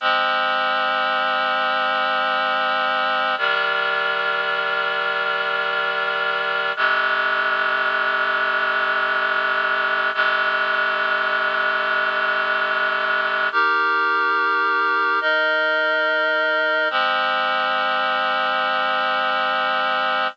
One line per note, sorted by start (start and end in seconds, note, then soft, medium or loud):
0.01 3.35 F3 medium
0.01 3.35 G#3 loud
0.01 3.35 C4 loud
3.38 6.72 C3 medium
3.38 6.72 D#3 loud
3.38 6.72 G3 loud
6.76 10.11 F2 loud
6.76 10.11 C3 loud
6.76 10.11 G#3 medium
10.14 13.49 F2 loud
10.14 13.49 C3 loud
10.14 13.49 G#3 medium
13.52 15.20 D#4 loud
13.52 15.20 G4 loud
13.52 15.20 A#4 loud
15.21 16.88 D#4 medium
15.21 16.88 A#4 loud
15.21 16.88 D#5 loud
16.90 20.27 F3 loud
16.90 20.27 G#3 loud
16.90 20.27 C4 medium